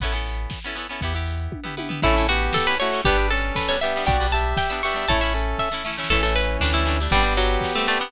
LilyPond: <<
  \new Staff \with { instrumentName = "Pizzicato Strings" } { \time 2/2 \key a \mixolydian \tempo 2 = 118 r1 | r1 | e'4 fis'4 a'8 b'8 cis''4 | g'4 a'4 b'8 cis''8 e''4 |
g''4 a''4 g''8 e'''8 cis'''4 | a''8 e''4. e''4. r8 | a'8 a'8 b'4 d'8 e'4. | g4 fis4. a8 a8 b8 | }
  \new Staff \with { instrumentName = "Lead 1 (square)" } { \time 2/2 \key a \mixolydian r1 | r1 | <cis' a'>4 <b g'>2 <a fis'>4 | <d' b'>4 <cis' a'>2 <b g'>4 |
<fis' d''>4 <g' e''>2 <g' e''>4 | <e' cis''>4 <cis' a'>4. r4. | <e cis'>1 | <b g'>1 | }
  \new Staff \with { instrumentName = "Orchestral Harp" } { \time 2/2 \key a \mixolydian <b cis' e' a'>8 <b cis' e' a'>2 <b cis' e' a'>8 <b cis' e' a'>8 <b cis' e' a'>8 | <b e' g'>8 <b e' g'>2 <b e' g'>8 <b e' g'>8 <b e' g'>8 | <a cis' e'>8 <a cis' e'>2 <a cis' e'>8 <a cis' e'>8 <a cis' e'>8 | <g b d'>8 <g b d'>2 <g b d'>8 <g b d'>8 <g b d'>8 |
<g b d'>8 <g b d'>2 <g b d'>8 <g b d'>8 <g b d'>8 | <a cis' e'>8 <a cis' e'>2 <a cis' e'>8 <a cis' e'>8 <a cis' e'>8 | <a cis' e'>8 <a cis' e'>4. <g a d'>8 <g a d'>8 <g a d'>8 <g a d'>8 | <g c' d'>8 <g c' d'>2 <g c' d'>8 <g c' d'>8 <g c' d'>8 | }
  \new Staff \with { instrumentName = "Synth Bass 2" } { \clef bass \time 2/2 \key a \mixolydian a,,2 r2 | e,2 r2 | a,,2 r2 | g,,2 r2 |
b,,2 r2 | a,,2 r2 | a,,2 d,2 | g,,2 r2 | }
  \new DrumStaff \with { instrumentName = "Drums" } \drummode { \time 2/2 <hh bd>8 hh8 hho8 hh8 <bd sn>8 hh8 hho8 hh8 | <hh bd>8 hh8 hho8 hh8 <bd tommh>8 tomfh8 tommh8 tomfh8 | <cymc bd>8 hh8 hho8 hh8 <bd sn>8 hh8 hho8 hh8 | <hh bd>8 hh8 hho8 hh8 <bd sn>8 hh8 hho8 hh8 |
<hh bd>8 hh8 hho8 hh8 <bd sn>8 hh8 hho8 hh8 | <hh bd>8 hh8 hho8 hh8 <bd sn>8 sn8 sn16 sn16 sn16 sn16 | <cymc bd>8 hh8 hho8 hh8 <bd sn>8 hh8 hho8 hh8 | <hh bd>8 hh8 hho8 hh8 <bd sn>8 hh8 hho8 hh8 | }
>>